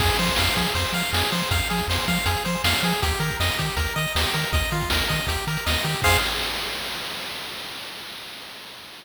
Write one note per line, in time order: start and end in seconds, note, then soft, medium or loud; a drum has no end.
0.00 0.10 F2 loud
0.00 0.17 G#4 medium
0.00 kick loud
0.00 crash loud
0.09 closed hi-hat medium
0.18 0.30 F3 medium
0.18 0.36 C5 medium
0.18 closed hi-hat medium
0.27 kick medium
0.27 closed hi-hat medium
0.36 0.49 F2 medium
0.36 0.55 F5 medium
0.36 snare loud
0.47 closed hi-hat medium
0.56 0.67 F3 medium
0.56 0.73 G#4 medium
0.56 kick medium
0.56 closed hi-hat medium
0.67 closed hi-hat medium
0.75 0.85 F2 medium
0.75 0.92 C5 medium
0.75 kick medium
0.75 closed hi-hat medium
0.86 closed hi-hat medium
0.93 1.03 F3 medium
0.93 1.11 F5 medium
0.93 closed hi-hat medium
1.03 closed hi-hat medium
1.13 1.23 F2 medium
1.13 1.30 G#4 medium
1.13 snare loud
1.23 closed hi-hat medium
1.32 1.43 F3 medium
1.32 1.49 C5 medium
1.32 closed hi-hat medium
1.41 closed hi-hat medium
1.51 1.61 F2 medium
1.51 1.68 F5 medium
1.51 kick loud
1.51 closed hi-hat loud
1.62 closed hi-hat medium
1.70 1.81 F3 medium
1.70 1.87 G#4 medium
1.70 closed hi-hat medium
1.77 kick medium
1.77 closed hi-hat medium
1.88 1.98 F2 medium
1.88 2.06 C5 medium
1.88 snare loud
1.99 closed hi-hat medium
2.07 2.18 F3 loud
2.07 2.25 F5 medium
2.07 kick medium
2.07 closed hi-hat medium
2.17 closed hi-hat medium
2.26 2.36 F2 medium
2.26 2.43 G#4 medium
2.26 kick medium
2.26 closed hi-hat loud
2.37 closed hi-hat medium
2.45 2.56 F3 medium
2.45 2.62 C5 medium
2.45 closed hi-hat medium
2.55 closed hi-hat medium
2.64 2.74 F2 medium
2.64 2.81 F5 medium
2.64 snare loud
2.74 closed hi-hat medium
2.83 2.93 F3 loud
2.83 3.01 G#4 medium
2.83 closed hi-hat medium
2.93 closed hi-hat medium
3.02 3.13 D#2 loud
3.02 3.19 G4 medium
3.02 kick medium
3.02 closed hi-hat loud
3.11 closed hi-hat medium
3.20 3.30 D#3 medium
3.20 3.37 A#4 medium
3.20 closed hi-hat medium
3.31 kick medium
3.31 closed hi-hat medium
3.40 3.50 F2 medium
3.40 3.57 D#5 medium
3.40 snare loud
3.51 closed hi-hat medium
3.59 3.70 D#3 medium
3.59 3.76 G4 medium
3.59 kick medium
3.59 closed hi-hat medium
3.70 closed hi-hat medium
3.77 3.87 D#2 medium
3.77 3.94 A#4 medium
3.77 kick medium
3.77 closed hi-hat medium
3.87 closed hi-hat medium
3.96 4.07 D#3 medium
3.96 4.13 D#5 medium
3.96 closed hi-hat medium
4.08 closed hi-hat medium
4.15 4.26 D#2 medium
4.15 4.33 G4 medium
4.15 snare loud
4.23 closed hi-hat medium
4.34 4.45 D#3 medium
4.34 4.51 A#4 medium
4.34 closed hi-hat medium
4.44 closed hi-hat medium
4.53 4.63 D#2 medium
4.53 4.70 D#5 medium
4.53 kick loud
4.53 closed hi-hat medium
4.64 closed hi-hat medium
4.71 4.82 D#3 medium
4.71 4.89 F4 medium
4.71 closed hi-hat medium
4.81 kick medium
4.81 closed hi-hat medium
4.90 5.02 D#2 medium
4.90 5.08 A#4 medium
4.90 snare loud
5.01 closed hi-hat medium
5.09 5.20 D#3 medium
5.09 5.26 D#5 medium
5.09 kick medium
5.09 closed hi-hat medium
5.20 closed hi-hat medium
5.27 5.37 D#2 medium
5.27 5.45 G4 medium
5.27 kick medium
5.27 closed hi-hat loud
5.37 closed hi-hat medium
5.47 5.58 D#3 medium
5.47 5.65 A#4 medium
5.47 closed hi-hat medium
5.57 closed hi-hat medium
5.66 5.77 D#2 medium
5.66 5.83 D#5 medium
5.66 snare loud
5.74 closed hi-hat medium
5.84 5.95 D#3 medium
5.84 6.01 G4 medium
5.84 closed hi-hat medium
5.94 closed hi-hat medium
6.02 6.17 F2 loud
6.02 6.17 G#4 loud
6.02 6.17 C5 medium
6.02 6.17 F5 loud
6.02 kick loud
6.02 crash loud